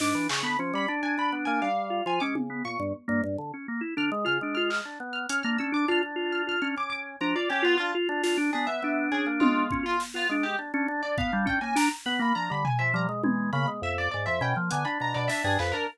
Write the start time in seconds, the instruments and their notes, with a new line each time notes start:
0.00 drawbar organ G#2 D4, orchestral harp D6, snare
0.15 drawbar organ E3
0.29 drawbar organ C#3, orchestral harp C#6, clap
0.43 drawbar organ D3 B3, orchestral harp B5
0.59 drawbar organ F3 C#4
0.74 drawbar organ G3, orchestral harp B5
0.88 drawbar organ D4
1.03 drawbar organ D4, orchestral harp G#5
1.18 drawbar organ D4, orchestral harp B5
1.32 drawbar organ B3
1.45 drawbar organ A#3, orchestral harp G#5
1.62 drawbar organ G3, orchestral harp F5
1.90 drawbar organ F4
2.06 drawbar organ F3 F4, orchestral harp G#5
2.20 drawbar organ G#3 C#4, orchestral harp D6
2.35 drawbar organ C#3, high tom
2.50 drawbar organ B3
2.65 drawbar organ A#2, orchestral harp C#6
2.80 drawbar organ G2
3.08 drawbar organ G2 A#3
3.24 drawbar organ G2
3.38 drawbar organ D3
3.54 drawbar organ C#4
3.68 drawbar organ A#3
3.81 drawbar organ E4
3.97 drawbar organ D3 D4, orchestral harp F6
4.12 drawbar organ G#3
4.25 drawbar organ C#3 F4, orchestral harp F6
4.41 drawbar organ G#3 D4
4.55 drawbar organ F4, orchestral harp F6
4.70 orchestral harp F6, clap
4.85 drawbar organ D4
5.00 drawbar organ B3
5.13 orchestral harp F6
5.29 drawbar organ C#4, orchestral harp F6, closed hi-hat
5.43 drawbar organ A#3 D4, orchestral harp F6
5.58 drawbar organ C#4 D4, orchestral harp E6
5.72 drawbar organ D4, orchestral harp D6
5.88 drawbar organ D4 F4, orchestral harp F6
6.03 drawbar organ D4
6.16 drawbar organ F4
6.32 orchestral harp F6
6.47 drawbar organ F4, orchestral harp F6
6.62 drawbar organ C#4 D4, orchestral harp F6
6.76 drawbar organ C#4, orchestral harp D6
6.90 orchestral harp D6
7.21 drawbar organ F3 D4, orchestral harp A#5
7.35 drawbar organ F4, orchestral harp D5
7.50 drawbar organ C#4, orchestral harp G4
7.62 drawbar organ B3 F4, orchestral harp F4
7.78 drawbar organ D4, orchestral harp F4
7.95 drawbar organ F4
8.09 drawbar organ D4 F4
8.23 drawbar organ D4 F4, snare
8.37 drawbar organ D4
8.53 drawbar organ B3 D4, orchestral harp G#4
8.67 drawbar organ B3, orchestral harp E5
8.82 drawbar organ B3 D4
9.12 drawbar organ C#4, orchestral harp G#4
9.26 drawbar organ A#3
9.40 drawbar organ G#3, orchestral harp F4, high tom
9.71 drawbar organ C#4, kick
9.83 drawbar organ F4, orchestral harp F4
10.00 snare
10.14 drawbar organ B3 F4, orchestral harp F4
10.29 drawbar organ G#3 D4
10.43 orchestral harp G4
10.59 drawbar organ D4
10.74 drawbar organ C#4 D4
10.88 drawbar organ D4
11.03 drawbar organ D4, orchestral harp D5
11.18 drawbar organ B3, orchestral harp F5, kick
11.32 drawbar organ G3 D4
11.46 drawbar organ C#4, orchestral harp G5, kick
11.61 drawbar organ A#3 C#4, orchestral harp G#5
11.75 drawbar organ D4, orchestral harp A#5, snare
12.06 drawbar organ B3, orchestral harp B5
12.19 drawbar organ A#3, orchestral harp B5
12.35 drawbar organ F3 D4, orchestral harp A#5
12.50 drawbar organ D3 G3, orchestral harp B5
12.65 orchestral harp G#5, floor tom
12.79 drawbar organ F3, orchestral harp E5
12.94 drawbar organ F3 G3, orchestral harp A#5
13.09 drawbar organ G#3
13.24 drawbar organ E3 G#3, high tom
13.53 drawbar organ C#3 A#3, orchestral harp B5
13.68 drawbar organ G#3
13.82 drawbar organ F2, orchestral harp E5
13.98 orchestral harp D5
14.11 drawbar organ G#2, orchestral harp D5
14.26 drawbar organ F2 F3, orchestral harp E5
14.41 drawbar organ B2 C#4, orchestral harp G5
14.56 drawbar organ F3 A#3
14.71 drawbar organ D3 B3, orchestral harp G#5, closed hi-hat
14.85 drawbar organ D4, orchestral harp B5
15.00 drawbar organ B2 D4, orchestral harp A#5
15.14 drawbar organ B2 D4, orchestral harp D5
15.28 drawbar organ D4, orchestral harp E5, snare
15.44 drawbar organ G2 D4, orchestral harp G#4
15.59 drawbar organ F2, orchestral harp B4, clap
15.72 drawbar organ D4, orchestral harp A#4